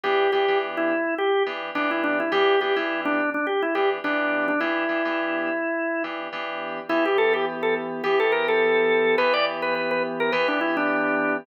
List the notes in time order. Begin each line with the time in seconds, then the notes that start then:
0.03 E3 B3 D4 G4
0.32 E3 B3 D4 G4
0.48 E3 B3 D4 G4
0.77 E4
1.18 G4
1.46 E3 B3 D4 G4
1.75 E3 B3 D4 G4
1.91 E4
2.04 D4
2.20 E4
2.32 E3 B3 D4 G4
2.61 E3 B3 D4 G4
2.76 E3 B3 D4 E4 G4
3.05 D4
3.34 D4
3.47 G4
3.63 E4
3.75 E3 B3 D4 G4
4.04 E3 B3 D4 G4
4.48 D4
4.60 E3 B3 D4 E4 G4
4.89 E3 B3 D4 G4
5.05 E3 B3 D4 G4
6.04 E3 B3 D4 G4
6.33 E3 B3 D4 G4
6.89 E3 B3 E4 G4
7.06 G4
7.18 A4
7.34 G4
7.63 A4
8.04 E3 B3 G4
8.20 A4
8.32 A#4
8.48 A4
9.18 E3 B3 G4 B4
9.33 D5
9.62 B4
9.75 B4
9.91 B4
10.20 A#4
10.32 E3 B3 G4 B4
10.48 D4
10.61 E4
10.77 D4